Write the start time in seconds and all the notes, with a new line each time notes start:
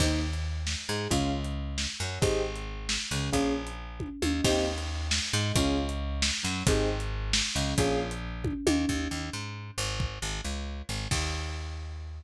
0.00 D#2 A#3 C4 D#4 G4, kick, crash
0.33 closed hi-hat
0.67 snare
0.89 G#2 G#3
1.10 C#2 C#4 F4 G#4, kick, closed hi-hat
1.44 closed hi-hat
1.78 snare
2.00 F#2 F#3
2.22 G#1 C4 D#4 G4 G#4, kick, closed hi-hat
2.56 closed hi-hat
2.89 snare
3.11 C#2 C#3
3.33 A#1 A#3 C#4 F4 G#4, kick, closed hi-hat
3.67 closed hi-hat
4.00 kick, high tom
4.22 D#2 D#3, high tom
4.44 D#2 A#3 C4 D#4 G4, kick, crash
4.78 closed hi-hat
5.11 snare
5.33 G#2 G#3
5.56 C#2 C#4 F4 G#4, kick, closed hi-hat
5.89 closed hi-hat
6.22 snare
6.43 F#2 F#3
6.67 G#1 C4 D#4 G4 G#4, kick, closed hi-hat
7.00 closed hi-hat
7.33 snare
7.55 C#2 C#3
7.78 A#1 A#3 C#4 F4 G#4, kick, closed hi-hat
8.11 closed hi-hat
8.44 kick, high tom
8.67 D#2 D#3, high tom
8.89 D#2, kick
9.11 D#2
9.33 G#2
9.78 G#1
10.00 kick
10.22 G#1
10.44 C#2
10.89 G#1
11.11 D#2, kick, crash